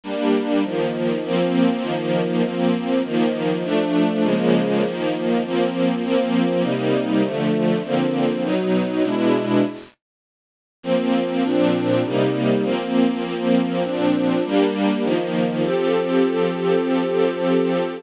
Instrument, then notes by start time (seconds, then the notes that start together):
string ensemble 1
0.04 G3 A#3 D4
0.64 D#3 F3 A#3
1.24 F3 A#3 C4
1.83 D#3 F3 A#3
2.43 F3 A#3 C4
3.04 D#3 F3 A#3
3.63 F3 A3 D4
4.24 C#3 F3 G#3 A#3
4.83 D#3 F3 A#3
5.43 F3 A#3 C4
6.04 F3 A#3 C4
6.63 C3 G3 A#3 D#4
7.23 D3 F3 A3
7.83 D3 F3 A#3 C4
8.43 B2 F#3 D#4
9.04 B2 G#3 D4 E4
10.83 F3 A#3 C4
11.44 A#2 F3 C4 D4
12.03 C3 G3 A#3 D#4
12.64 F3 A#3 C4
13.24 F3 A#3 C4
13.83 A#2 F3 C4 D4
14.44 G3 A#3 D4
15.03 D#3 F3 A#3
15.64 F3 C4 G4 A4